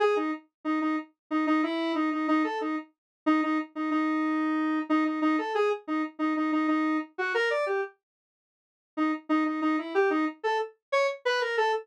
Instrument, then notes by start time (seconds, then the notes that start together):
lead 1 (square)
0.00 G#4
0.16 D#4
0.65 D#4
0.81 D#4
1.31 D#4
1.47 D#4
1.63 E4
1.95 D#4
2.12 D#4
2.28 D#4
2.44 A4
2.61 D#4
3.26 D#4
3.43 D#4
3.75 D#4
3.91 D#4
4.90 D#4
5.05 D#4
5.22 D#4
5.38 A4
5.55 G#4
5.88 D#4
6.19 D#4
6.36 D#4
6.52 D#4
6.68 D#4
7.18 F#4
7.34 A#4
7.50 D5
7.66 G4
8.97 D#4
9.29 D#4
9.45 D#4
9.62 D#4
9.78 E4
9.95 G4
10.10 D#4
10.43 A4
10.92 C#5
11.25 B4
11.41 A#4
11.57 A4